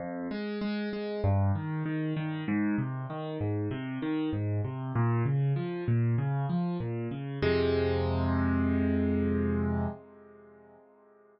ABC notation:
X:1
M:4/4
L:1/8
Q:1/4=97
K:Fm
V:1 name="Acoustic Grand Piano" clef=bass
F,, A, A, A, G,, E, E, E, | A,, C, E, A,, C, E, A,, C, | B,, D, F, B,, D, F, B,, D, | [F,,C,A,]8 |]